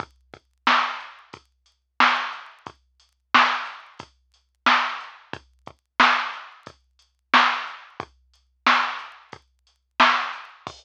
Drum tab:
CC |--------|--------|--------|--------|
HH |xx-xxx-x|xx-xxx-x|xx-xxx-x|xx-xxx-x|
SD |--o---o-|--o---o-|--o---o-|--o---o-|
BD |oo--o---|o---o---|oo--o---|o---o---|

CC |x-------|
HH |--------|
SD |--------|
BD |o-------|